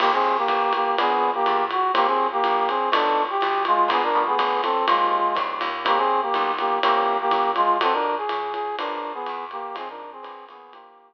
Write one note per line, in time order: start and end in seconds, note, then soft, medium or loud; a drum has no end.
0.00 0.44 D#2 loud
0.00 0.11 A#3 medium
0.00 0.33 A#3 medium
0.00 0.33 C4 medium
0.00 0.33 D#4 loud
0.00 0.11 G4 medium
0.00 0.33 G4 medium
0.00 crash medium
0.00 ride medium
0.13 0.36 C4 medium
0.13 0.36 G#4 medium
0.37 0.72 A#3 medium
0.37 0.72 G4 medium
0.48 0.93 A1 loud
0.48 kick soft
0.48 hi-hat pedal medium
0.48 ride medium
0.73 0.96 A#3 medium
0.73 0.96 G4 medium
0.73 ride medium
0.98 1.43 A#1 loud
0.98 1.33 A#3 medium
0.98 1.33 B3 loud
0.98 1.30 B3 medium
0.98 1.33 D4 medium
0.98 1.33 G#4 medium
0.98 1.30 G#4 medium
0.98 ride medium
1.34 1.64 A#3 medium
1.34 1.64 G4 medium
1.46 1.91 E2 loud
1.46 hi-hat pedal medium
1.46 ride medium
1.71 1.91 F#4 medium
1.71 ride medium
1.94 2.41 D#2 loud
1.94 2.28 A#3 medium
1.94 2.06 A#3 medium
1.94 2.28 C4 medium
1.94 2.28 D#4 medium
1.94 2.28 G4 medium
1.94 2.06 G4 medium
1.94 kick soft
1.94 ride medium
2.07 2.27 C4 medium
2.07 2.27 G#4 medium
2.32 2.68 A#3 medium
2.32 2.68 G4 medium
2.44 2.89 A#1 loud
2.44 hi-hat pedal medium
2.44 ride medium
2.68 2.89 C4 medium
2.68 2.89 G#4 medium
2.68 ride medium
2.92 3.38 B1 loud
2.92 3.26 A3 medium
2.92 3.26 B3 loud
2.92 3.22 D4 medium
2.92 3.26 D#4 loud
2.92 3.26 F#4 loud
2.92 3.22 A4 medium
2.92 ride medium
3.30 3.63 G4 medium
3.41 3.87 B1 loud
3.41 hi-hat pedal medium
3.41 ride medium
3.65 3.89 G#3 medium
3.65 3.89 F4 medium
3.65 ride medium
3.88 4.36 A#1 loud
3.88 4.11 G#3 loud
3.88 4.11 A#3 loud
3.88 4.11 B3 loud
3.88 4.02 B3 medium
3.88 4.11 D4 loud
3.88 4.02 G#4 medium
3.88 kick medium
3.88 ride medium
4.02 4.22 D4 medium
4.02 4.22 A#4 medium
4.15 4.74 F3 medium
4.15 4.74 G3 medium
4.15 4.74 A3 medium
4.15 4.74 B3 loud
4.27 4.61 B3 medium
4.27 4.61 G#4 medium
4.39 4.84 G1 loud
4.39 kick medium
4.39 hi-hat pedal medium
4.39 ride medium
4.63 4.86 C4 medium
4.63 4.86 A4 medium
4.63 ride medium
4.87 5.33 D#2 loud
4.87 5.21 D#3 loud
4.87 5.21 G3 medium
4.87 5.34 G#3 medium
4.87 5.21 A#3 medium
4.87 5.21 C4 medium
4.87 5.34 F4 medium
4.87 ride medium
5.35 5.61 E2 medium
5.35 5.69 D#3 medium
5.35 5.69 G3 medium
5.35 5.69 A#3 medium
5.35 5.69 C4 medium
5.35 kick medium
5.35 hi-hat pedal medium
5.35 ride medium
5.61 6.30 D#2 loud
5.61 ride medium
5.85 6.19 D#3 medium
5.85 6.19 G3 loud
5.85 6.19 A#3 loud
5.85 5.98 A#3 medium
5.85 6.19 C4 medium
5.85 5.98 G4 medium
5.85 kick soft
5.85 ride medium
5.97 6.20 C4 medium
5.97 6.20 G#4 medium
6.22 6.52 A#3 medium
6.22 6.52 G4 medium
6.34 6.79 B1 loud
6.34 hi-hat pedal medium
6.34 ride medium
6.59 6.79 A#3 medium
6.59 6.79 G4 medium
6.59 ride medium
6.83 7.27 C2 loud
6.83 7.17 E3 medium
6.83 7.17 A#3 medium
6.83 7.17 A#3 loud
6.83 7.17 C4 loud
6.83 7.17 C#4 loud
6.83 7.17 G4 medium
6.83 ride medium
7.21 7.51 A#3 medium
7.21 7.51 G4 medium
7.31 7.77 F#2 medium
7.31 kick medium
7.31 hi-hat pedal medium
7.31 ride medium
7.56 7.77 G#3 medium
7.56 7.77 F4 medium
7.56 ride medium
7.80 8.26 F2 loud
7.80 7.93 C4 medium
7.80 8.15 D#4 loud
7.80 8.15 F4 loud
7.80 8.15 F#4 medium
7.80 8.15 A4 medium
7.80 7.93 A4 medium
7.80 kick soft
7.80 ride medium
7.93 8.16 D4 medium
7.93 8.16 A#4 medium
8.17 8.53 G#4 medium
8.29 8.75 A2 medium
8.29 hi-hat pedal medium
8.29 ride medium
8.53 8.76 G#4 medium
8.53 ride medium
8.78 9.24 A#1 loud
8.78 9.12 D4 medium
8.78 9.13 D4 medium
8.78 9.13 G#4 loud
8.78 9.12 A#4 medium
8.78 9.13 A#4 medium
8.78 9.13 B4 medium
8.78 ride medium
9.14 9.45 B3 medium
9.14 9.45 G#4 medium
9.26 9.73 E2 loud
9.26 hi-hat pedal medium
9.26 ride medium
9.51 9.75 A#3 medium
9.51 9.75 G4 medium
9.51 ride medium
9.75 10.21 F2 loud
9.75 9.88 C4 medium
9.75 10.09 D#4 medium
9.75 10.09 F4 medium
9.75 10.09 G#4 medium
9.75 9.88 G#4 medium
9.75 10.09 C5 loud
9.75 ride medium
9.88 10.11 D4 medium
9.88 10.11 A#4 medium
10.12 10.45 C4 medium
10.12 10.45 G#4 medium
10.23 10.49 A#1 loud
10.23 10.57 D4 loud
10.23 10.57 G#4 loud
10.23 10.57 A#4 medium
10.23 10.57 B4 loud
10.23 hi-hat pedal medium
10.23 ride medium
10.49 11.14 D#2 loud
10.49 10.73 B3 medium
10.49 10.73 G#4 medium
10.49 ride medium
10.72 11.14 A#3 medium
10.72 11.09 D#4 medium
10.72 11.14 G4 medium
10.72 11.09 G4 loud
10.72 11.09 A#4 loud
10.72 11.09 C5 medium
10.72 ride medium